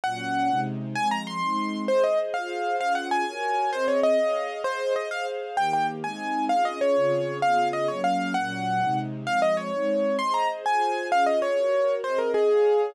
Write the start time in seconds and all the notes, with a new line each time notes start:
0.04 A#2 F#3 C#4 F#5
0.49 C3 G#3 D#4
0.96 F3 G#3 C4 G#5
1.11 A#5
1.27 C6
1.41 G#3 C4 D#4
1.88 G#4 C5 D#5
2.04 D#5
2.34 F4 G#4 C5 F5
2.79 C#4 F4 G#4 F5
2.95 F#5
3.11 G#5
3.27 F#4 A#4 C#5
3.73 C4 G#4 C5 D#5
3.88 C#5
4.03 D#5
4.18 G#4 C#5 F5
4.64 G#4 C5 D#5
4.96 D#5
5.11 G#4 C5 F5
5.57 D#3 A#3 G4 G5
5.73 G5
6.03 G#3 C4 D#4 G#5
6.49 C#4 F4 G#4 F5
6.65 D#5
6.81 C#5
6.96 C#3 C4 F4 G#4
7.42 C#3 B3 F4 G#4 F5
7.73 D#5
7.88 F#3 A#3 C#4 C#5
8.04 F5
8.34 A#2 F#3 C#4 F#5
8.81 C3 G#3 D#4
9.25 F3 G#3 C4 F5
9.42 D#5
9.57 C#5
9.73 G#3 C4 D#4
10.19 G#4 C5 D#5 C6
10.34 A#5
10.65 F4 G#4 C5 G#5
11.12 C#4 F4 G#4 F5
11.26 D#5
11.42 C#5
11.56 F#4 A#4 C#5
12.03 C4 G#4 C5 D#5
12.19 A#4
12.34 G#4
12.49 G#4 C#5 F5